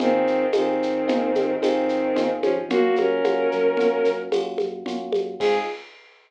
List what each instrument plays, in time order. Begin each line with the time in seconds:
0.00 synth bass 1 G#1, violin D#3 C4, electric piano 1 C4 D#4 F4 G#4, low conga, shaker
0.27 synth bass 1 G#1, shaker
0.52 synth bass 1 G#1, violin D#3 C4, electric piano 1 C4 D#4 F4 G#4, tambourine, high conga, shaker
0.82 synth bass 1 G#1, shaker
1.08 synth bass 1 G#1, electric piano 1 C4 D#4 F4 G#4, low conga, shaker
1.35 synth bass 1 G#1, high conga, shaker
1.60 synth bass 1 G#1, violin D#3 C4, electric piano 1 C4 D#4 F4 G#4, tambourine, high conga, shaker
1.89 synth bass 1 G#1, shaker
2.16 synth bass 1 G#1, electric piano 1 C4 D#4 F4 G#4, low conga, shaker
2.42 synth bass 1 G#1, violin F3 C#4, high conga, shaker
2.68 synth bass 1 F#2, electric piano 1 A#3 C#4 F4 F#4, violin A#3 F#4, low conga, shaker
2.96 synth bass 1 F#2, violin C#4 A#4, high conga, shaker
3.24 synth bass 1 F#2, electric piano 1 A#3 C#4 F4 F#4, high conga, shaker
3.52 synth bass 1 F#2, shaker
3.77 synth bass 1 F#2, electric piano 1 A#3 C#4 F4 F#4, low conga, shaker
4.05 synth bass 1 F#2, shaker
4.32 synth bass 1 F#2, electric piano 1 A#3 C#4 F4 F#4, tambourine, high conga, shaker
4.58 synth bass 1 F#2, high conga, shaker
4.86 synth bass 1 F#2, electric piano 1 A#3 C#4 F4 F#4, low conga, shaker
5.13 synth bass 1 F#2, high conga, shaker
5.40 synth bass 1 G#2, electric piano 1 C4 D#4 F4 G#4, violin G#4, kick, crash